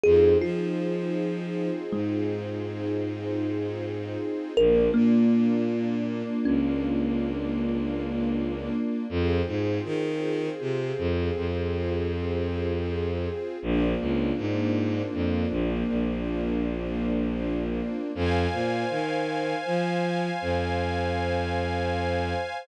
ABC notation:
X:1
M:6/8
L:1/8
Q:3/8=53
K:Fdor
V:1 name="Kalimba"
A F4 A,- | A,6 | B B,4 _D- | _D6 |
z6 | z6 | z6 | z6 |
z6 | z6 |]
V:2 name="String Ensemble 1"
[CEFA]6- | [CEFA]6 | [B,DF]6- | [B,DF]6 |
[CFA]6- | [CFA]6 | [B,CDF]6- | [B,CDF]6 |
[cfa]6- | [cfa]6 |]
V:3 name="Violin" clef=bass
F,, F,4 A,,- | A,,6 | B,,, B,,4 _D,,- | _D,,6 |
F,, A,, E,2 C, F,, | F,,6 | B,,, _D,, A,,2 F,, B,,, | B,,,6 |
F,, B,, E,2 F,2 | F,,6 |]